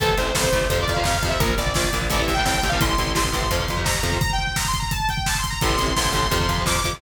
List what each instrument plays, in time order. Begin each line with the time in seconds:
0.00 electric bass (finger) A1, overdriven guitar C3 E3 A3, lead 2 (sawtooth) A4, kick, closed hi-hat
0.09 kick
0.17 electric bass (finger) A1, overdriven guitar C3 E3 A3, lead 2 (sawtooth) C5, kick, closed hi-hat
0.35 electric bass (finger) A1, overdriven guitar C3 E3 A3, lead 2 (sawtooth) C5, kick, snare
0.44 kick
0.53 electric bass (finger) A1, overdriven guitar C3 E3 A3, kick, closed hi-hat
0.61 kick
0.70 electric bass (finger) F2, overdriven guitar C3 F3, lead 2 (sawtooth) C5, kick, closed hi-hat
0.78 overdriven guitar C3 F3, lead 2 (sawtooth) D5, kick
0.88 electric bass (finger) F2, kick, closed hi-hat
0.94 overdriven guitar C3 F3, lead 2 (sawtooth) F5, kick
1.04 electric bass (finger) F2, overdriven guitar C3 F3, lead 2 (sawtooth) F5, kick, snare
1.14 lead 2 (sawtooth) F5, kick
1.23 electric bass (finger) F2, overdriven guitar C3 F3, kick, closed hi-hat
1.29 overdriven guitar C3 F3, lead 2 (sawtooth) E5, kick
1.40 electric bass (finger) A#1, overdriven guitar A#2 F3, lead 2 (sawtooth) A#4, kick, closed hi-hat
1.49 kick
1.58 electric bass (finger) A#1, overdriven guitar A#2 F3, lead 2 (sawtooth) D5, kick, closed hi-hat
1.67 kick
1.74 electric bass (finger) A#1, overdriven guitar A#2 F3, lead 2 (sawtooth) D5, kick, snare
1.84 kick
1.93 electric bass (finger) A#1, overdriven guitar A#2 F3, kick, closed hi-hat
2.02 kick
2.10 electric bass (finger) A1, overdriven guitar A2 C3 E3, lead 2 (sawtooth) D5, kick, closed hi-hat
2.19 overdriven guitar A2 C3 E3, kick
2.23 lead 2 (sawtooth) E5
2.28 electric bass (finger) A1, kick, closed hi-hat
2.34 lead 2 (sawtooth) G5, kick
2.38 overdriven guitar A2 C3 E3
2.45 electric bass (finger) A1, overdriven guitar A2 C3 E3, lead 2 (sawtooth) G5, kick, snare
2.54 lead 2 (sawtooth) G5, kick
2.63 electric bass (finger) A1, overdriven guitar A2 C3 E3, kick, closed hi-hat
2.69 lead 2 (sawtooth) F5, kick
2.73 overdriven guitar A2 C3 E3
2.81 electric bass (finger) A1, overdriven guitar A2 C3 E3, lead 2 (sawtooth) C6, kick, closed hi-hat
2.89 kick
2.98 electric bass (finger) A1, overdriven guitar A2 C3 E3, kick, closed hi-hat
3.07 kick
3.15 electric bass (finger) A1, overdriven guitar A2 C3 E3, lead 2 (sawtooth) C6, kick, snare
3.25 kick
3.32 electric bass (finger) A1, overdriven guitar A2 C3 E3, kick, closed hi-hat
3.42 kick
3.51 electric bass (finger) F2, overdriven guitar C3 F3, kick, closed hi-hat
3.60 overdriven guitar C3 F3, kick
3.68 electric bass (finger) F2, kick, closed hi-hat
3.77 overdriven guitar C3 F3, kick
3.84 electric bass (finger) F2, overdriven guitar C3 F3, lead 2 (sawtooth) A#5, kick, snare
3.95 kick
4.03 electric bass (finger) F2, overdriven guitar C3 F3, kick, closed hi-hat
4.12 overdriven guitar C3 F3, kick
4.21 lead 2 (sawtooth) A#5, kick, closed hi-hat
4.30 lead 2 (sawtooth) G5, kick
4.39 kick
4.44 lead 2 (sawtooth) G5, kick
4.56 lead 2 (sawtooth) A#5, kick, snare, closed hi-hat
4.65 lead 2 (sawtooth) C6, kick
4.74 kick, closed hi-hat
4.79 lead 2 (sawtooth) A#5, kick
4.91 lead 2 (sawtooth) A5, kick, closed hi-hat
5.00 kick
5.09 lead 2 (sawtooth) G5, kick, closed hi-hat
5.17 kick
5.26 lead 2 (sawtooth) A5, kick, snare
5.35 lead 2 (sawtooth) C6, kick
5.44 kick, closed hi-hat
5.50 lead 2 (sawtooth) A#5, kick
5.61 electric bass (finger) A1, overdriven guitar A2 C3 E3, lead 2 (sawtooth) C6, kick, closed hi-hat
5.70 kick
5.78 electric bass (finger) A1, overdriven guitar A2 C3 E3, kick, closed hi-hat
5.88 kick
5.96 electric bass (finger) A1, overdriven guitar A2 C3 E3, lead 2 (sawtooth) C6, kick, snare
6.05 kick
6.12 electric bass (finger) A1, overdriven guitar A2 C3 E3, kick, closed hi-hat
6.23 kick
6.31 electric bass (finger) F2, overdriven guitar C3 F3, kick, closed hi-hat
6.40 overdriven guitar C3 F3, kick
6.49 electric bass (finger) F2, kick, closed hi-hat
6.58 overdriven guitar C3 F3, kick
6.66 electric bass (finger) F2, overdriven guitar C3 F3, lead 2 (sawtooth) D6, kick, snare
6.76 kick
6.84 electric bass (finger) F2, overdriven guitar C3 F3, kick, closed hi-hat
6.93 overdriven guitar C3 F3, kick